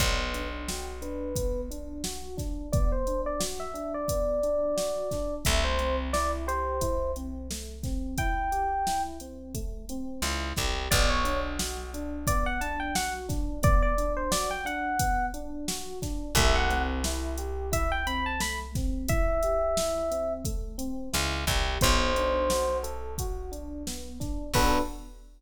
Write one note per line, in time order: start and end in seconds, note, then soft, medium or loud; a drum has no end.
0.00 5.03 B1 loud
0.00 0.33 B3 loud
0.00 0.17 D5 loud
0.00 kick loud
0.00 closed hi-hat loud
0.19 0.48 B4 medium
0.34 0.65 D4 medium
0.34 closed hi-hat medium
0.68 1.00 F#4 medium
0.68 0.86 G5 medium
0.68 snare loud
1.02 1.33 D4 medium
1.02 1.61 B4 medium
1.02 closed hi-hat medium
1.36 1.69 B3 medium
1.36 kick loud
1.36 closed hi-hat loud
1.71 2.02 D4 medium
1.71 closed hi-hat medium
2.04 2.35 F#4 medium
2.04 snare loud
2.37 2.68 D4 medium
2.37 kick medium
2.37 snare medium
2.37 closed hi-hat medium
2.72 3.04 B3 medium
2.72 2.90 D5 loud
2.72 kick loud
2.72 closed hi-hat loud
2.92 3.21 C5 medium
3.07 3.38 D4 medium
3.07 closed hi-hat medium
3.26 3.41 D5 medium
3.40 3.71 F#4 medium
3.40 snare loud
3.60 3.93 E5 medium
3.74 4.05 D4 medium
3.74 closed hi-hat medium
3.94 5.34 D5 medium
4.08 4.40 B3 medium
4.08 kick medium
4.08 closed hi-hat loud
4.43 4.74 D4 medium
4.43 closed hi-hat medium
4.77 5.08 F#4 medium
4.77 snare loud
5.11 5.43 D4 medium
5.11 kick medium
5.11 snare medium
5.11 closed hi-hat medium
5.45 10.01 C2 loud
5.45 5.77 A3 medium
5.45 5.64 E5 medium
5.45 kick loud
5.45 closed hi-hat loud
5.64 5.96 C5 medium
5.79 6.10 C4 medium
5.79 closed hi-hat medium
6.13 6.45 E4 medium
6.13 6.31 D5 medium
6.13 snare loud
6.47 6.78 G4 medium
6.47 7.12 C5 medium
6.47 closed hi-hat medium
6.81 7.12 E4 medium
6.81 kick medium
6.81 closed hi-hat loud
7.16 7.48 C4 medium
7.16 closed hi-hat medium
7.51 7.82 A3 medium
7.51 snare loud
7.83 8.15 C4 medium
7.83 kick medium
7.83 snare medium
7.83 closed hi-hat medium
8.18 8.49 E4 medium
8.18 9.02 G5 medium
8.18 kick loud
8.18 closed hi-hat loud
8.52 8.83 G4 medium
8.52 closed hi-hat medium
8.87 9.18 E4 medium
8.87 snare loud
9.20 9.52 C4 medium
9.20 closed hi-hat medium
9.54 9.86 A3 medium
9.54 kick medium
9.54 closed hi-hat medium
9.89 10.21 C4 medium
9.89 closed hi-hat medium
10.22 10.53 C#2 medium
10.22 10.54 E4 medium
10.22 snare loud
10.56 10.88 C2 medium
10.56 10.88 G4 medium
10.56 kick medium
10.56 snare medium
10.56 closed hi-hat medium
10.91 15.94 B1 loud
10.91 11.23 B3 loud
10.91 11.09 D5 loud
10.91 kick loud
10.91 closed hi-hat loud
11.10 11.39 C#5 medium
11.25 11.56 D4 medium
11.25 closed hi-hat medium
11.59 11.90 F#4 medium
11.59 snare loud
11.94 12.25 D4 medium
11.94 closed hi-hat medium
12.27 12.60 B3 medium
12.27 12.45 D5 medium
12.27 kick loud
12.27 closed hi-hat loud
12.46 12.61 F#5 medium
12.61 12.92 D4 medium
12.61 12.79 A5 medium
12.61 closed hi-hat medium
12.80 12.94 G5 medium
12.95 13.26 F#4 medium
12.95 13.13 F#5 loud
12.95 snare loud
13.29 13.60 D4 medium
13.29 kick loud
13.29 snare medium
13.29 closed hi-hat medium
13.63 13.94 B3 medium
13.63 13.82 D5 loud
13.63 kick loud
13.63 closed hi-hat loud
13.82 14.12 D5 medium
13.98 14.29 D4 medium
13.98 closed hi-hat medium
14.17 14.31 C5 medium
14.31 14.62 F#4 medium
14.31 14.49 D5 medium
14.31 snare loud
14.51 14.65 G5 medium
14.65 14.96 D4 medium
14.65 15.26 F#5 loud
14.65 closed hi-hat medium
14.99 15.31 B3 medium
14.99 kick loud
14.99 closed hi-hat loud
15.34 15.65 D4 medium
15.34 closed hi-hat medium
15.68 15.99 F#4 medium
15.68 snare loud
16.02 16.33 D4 medium
16.02 kick medium
16.02 snare medium
16.02 closed hi-hat medium
16.35 20.89 C2 loud
16.35 16.68 A3 loud
16.35 16.55 E5 loud
16.35 kick loud
16.35 closed hi-hat loud
16.55 16.83 F#5 medium
16.69 17.00 C4 medium
16.69 closed hi-hat medium
17.04 17.36 E4 medium
17.04 snare loud
17.37 17.70 G4 medium
17.37 closed hi-hat medium
17.72 18.03 E4 medium
17.72 17.91 E5 medium
17.72 kick loud
17.72 closed hi-hat loud
17.92 18.06 G5 medium
18.07 18.38 C4 medium
18.07 18.25 B5 medium
18.07 closed hi-hat medium
18.26 18.40 A5 medium
18.40 18.71 A3 medium
18.40 18.59 B5 medium
18.40 snare loud
18.75 19.07 C4 medium
18.75 kick loud
18.75 snare medium
18.75 closed hi-hat medium
19.08 19.39 E4 medium
19.08 20.33 E5 loud
19.08 kick loud
19.08 closed hi-hat loud
19.43 19.75 G4 medium
19.43 closed hi-hat medium
19.77 20.09 E4 medium
19.77 snare loud
20.11 20.42 C4 medium
20.11 closed hi-hat medium
20.45 20.76 A3 medium
20.45 kick medium
20.45 closed hi-hat loud
20.78 21.09 C4 medium
20.78 closed hi-hat medium
21.13 21.45 C#2 loud
21.13 21.44 E4 medium
21.13 snare loud
21.47 21.78 C2 loud
21.47 21.78 G4 medium
21.47 kick loud
21.47 snare medium
21.47 closed hi-hat medium
21.81 24.35 B1 loud
21.81 22.12 B3 medium
21.81 22.77 C5 loud
21.81 kick loud
21.81 closed hi-hat loud
22.16 22.48 D4 medium
22.16 closed hi-hat medium
22.50 22.82 F#4 medium
22.50 snare loud
22.83 23.14 A4 medium
22.83 closed hi-hat medium
23.18 23.51 F#4 medium
23.18 kick medium
23.18 closed hi-hat loud
23.52 23.83 D4 medium
23.52 closed hi-hat medium
23.87 24.18 B3 medium
23.87 snare loud
24.20 24.51 D4 medium
24.20 kick medium
24.20 snare medium
24.20 closed hi-hat medium
24.54 24.79 B1 medium
24.54 24.81 B3 loud
24.54 24.81 D4 loud
24.54 24.81 F#4 medium
24.54 24.81 A4 loud
24.54 24.80 B4 loud
24.54 kick loud
24.54 crash loud